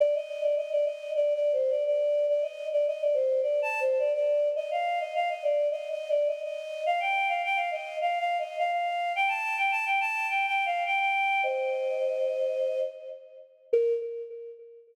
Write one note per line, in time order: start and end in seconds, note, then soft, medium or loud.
0.00 0.14 D5 medium
0.15 0.42 D#5 medium
0.42 0.55 D5 medium
0.56 0.70 D#5 medium
0.72 0.85 D5 medium
0.85 1.10 D#5 medium
1.15 1.33 D5 medium
1.34 1.52 D5 medium
1.53 1.71 C5 medium
1.70 1.83 D5 medium
1.86 2.26 D5 medium
2.29 2.42 D5 medium
2.42 2.66 D#5 medium
2.72 2.86 D5 medium
2.87 3.01 D#5 medium
3.01 3.15 D5 medium
3.14 3.40 C5 medium
3.42 3.60 D5 medium
3.62 3.80 A5 medium
3.80 3.98 C5 medium
3.99 4.12 D5 medium
4.14 4.48 D5 medium
4.56 4.69 D#5 medium
4.71 4.99 F5 medium
5.00 5.13 D#5 medium
5.15 5.29 F5 medium
5.29 5.43 D#5 medium
5.43 5.68 D5 medium
5.71 5.89 D#5 medium
5.90 6.09 D#5 medium
6.09 6.28 D5 medium
6.27 6.41 D#5 medium
6.44 6.83 D#5 medium
6.86 7.00 F5 medium
7.00 7.28 G5 medium
7.28 7.42 F5 medium
7.44 7.58 G5 medium
7.56 7.70 F5 medium
7.71 7.96 D#5 medium
8.01 8.19 F5 medium
8.19 8.37 F5 medium
8.39 8.57 D#5 medium
8.58 8.71 F5 medium
8.72 9.13 F5 medium
9.16 9.29 G5 medium
9.28 9.56 A5 medium
9.58 9.71 G5 medium
9.71 9.85 A5 medium
9.86 9.99 G5 medium
10.00 10.27 A5 medium
10.29 10.46 G5 medium
10.46 10.65 G5 medium
10.66 10.84 F5 medium
10.86 10.99 G5 medium
11.00 11.41 G5 medium
11.43 12.80 C5 medium
11.43 12.80 D#5 medium
13.73 13.93 A#4 loud